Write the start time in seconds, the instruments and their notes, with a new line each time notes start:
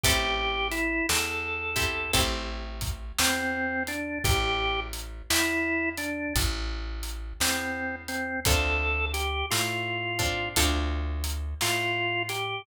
0.04 electric bass (finger) A1, acoustic guitar (steel) C4 E4 G4 A4, drawbar organ G4, kick, closed hi-hat
0.71 drawbar organ E4, closed hi-hat
1.09 electric bass (finger) E2, drawbar organ A4, snare
1.76 acoustic guitar (steel) C4 E4 G4 A4, kick, closed hi-hat
2.13 electric bass (finger) A1, acoustic guitar (steel) C4 E4 G4 A4, kick, closed hi-hat
2.81 kick, closed hi-hat
3.18 electric bass (finger) E2, drawbar organ C4, snare
3.87 drawbar organ D4, closed hi-hat
4.24 electric bass (finger) A1, drawbar organ G4, kick, closed hi-hat
4.93 closed hi-hat
5.30 electric bass (finger) E2, drawbar organ E4, snare
5.97 drawbar organ D4, closed hi-hat
6.36 electric bass (finger) A1, kick, closed hi-hat
7.03 closed hi-hat
7.40 electric bass (finger) E2, drawbar organ C4, snare
8.08 drawbar organ C4, closed hi-hat
8.45 electric bass (finger) D2, acoustic guitar (steel) C4 D4 F4 A4, drawbar organ A4, kick, closed hi-hat
9.13 drawbar organ G4, closed hi-hat
9.50 electric bass (finger) A2, drawbar organ F4, snare
10.19 acoustic guitar (steel) C4 D4 F4 A4, kick, closed hi-hat
10.56 electric bass (finger) D2, acoustic guitar (steel) C4 D4 F4 A4, kick, closed hi-hat
11.24 closed hi-hat
11.61 electric bass (finger) A2, drawbar organ F4, snare
12.29 drawbar organ G4, closed hi-hat